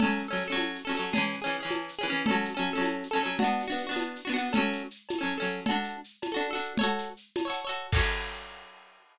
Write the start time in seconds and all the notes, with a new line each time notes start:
0.00 C#4 A4, cowbell, low conga, shaker
0.04 F#3
0.19 shaker
0.28 C#4 A4
0.33 F#3, shaker
0.48 C#4 A4
0.52 F#3, cowbell
0.57 tambourine, high conga, shaker
0.75 shaker
0.85 C#4 A4
0.89 F#3
0.95 C#4 A4, shaker
0.99 F#3
1.13 C#4 G#4, cowbell, low conga, shaker
1.18 E3
1.32 shaker
1.42 C#4 G#4
1.46 E3
1.51 shaker
1.60 C#4 G#4
1.65 E3
1.71 tambourine, cowbell, high conga, shaker
1.88 shaker
1.99 C#4 G#4
2.03 E3
2.07 C#4 G#4, shaker
2.12 E3
2.26 C#4 A4, cowbell, low conga, shaker
2.31 F#3
2.45 shaker
2.54 C#4 A4
2.59 F#3
2.64 shaker
2.73 C#4 A4
2.78 F#3, cowbell
2.82 tambourine, high conga, shaker
3.03 shaker
3.11 C#4 A4
3.16 F#3
3.21 C#4 A4, shaker
3.25 F#3
3.39 D4 F#4, cowbell, low conga, shaker
3.44 B3
3.60 shaker
3.68 D4 F#4
3.72 B3
3.78 shaker
3.87 D4 F#4
3.91 B3
3.96 tambourine, cowbell, high conga, shaker
4.16 shaker
4.25 D4 F#4
4.29 B3
4.34 D4 F#4, shaker
4.38 B3
4.53 C#4 A4, cowbell, low conga, shaker
4.57 F#3
4.73 shaker
4.91 shaker
5.09 tambourine, cowbell, high conga, shaker
5.19 C#4 A4
5.23 F#3
5.27 shaker
5.38 C#4 A4
5.42 F#3
5.48 shaker
5.66 F#4 A4, cowbell, low conga, shaker
5.71 D4
5.84 shaker
6.04 shaker
6.22 tambourine, cowbell, high conga, shaker
6.32 F#4 A4
6.37 D4
6.42 shaker
6.51 F#4 A4
6.55 D4
6.61 shaker
6.77 A4 C#5, cowbell, low conga, shaker
6.83 F#4
6.98 shaker
7.17 shaker
7.36 tambourine, cowbell, high conga, shaker
7.45 A4 C#5
7.50 F#4, shaker
7.65 A4 C#5
7.69 F#4
7.74 shaker
7.92 C#4 A4, kick, crash
7.97 F#3